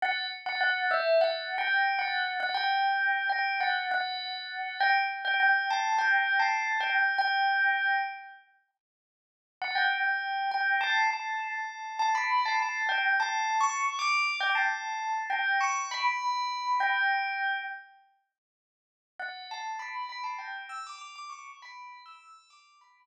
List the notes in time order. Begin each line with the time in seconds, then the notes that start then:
0.02 F#5
0.46 F#5
0.61 F#5
0.91 E5
1.21 F#5
1.58 G5
1.99 F#5
2.40 F#5
2.54 G5
3.29 G5
3.60 F#5
3.91 F#5
4.80 G5
5.25 G5
5.40 G5
5.71 A5
5.98 G5
6.40 A5
6.80 G5
7.18 G5
9.62 F#5
9.75 G5
10.51 G5
10.81 A5
11.11 A5
11.99 A5
12.15 B5
12.46 A5
12.60 A5
12.89 G5
13.20 A5
13.61 C#6
13.99 D6
14.40 G5
14.55 A5
15.30 G5
15.61 C#6
15.91 B5
16.80 G5
19.20 F#5
19.51 A5
19.79 B5
20.09 B5
20.24 A5
20.39 G5
20.69 E6
20.87 D6
20.98 D6
21.16 D6
21.30 C#6
21.62 B5
22.06 E6
22.50 D6
22.81 B5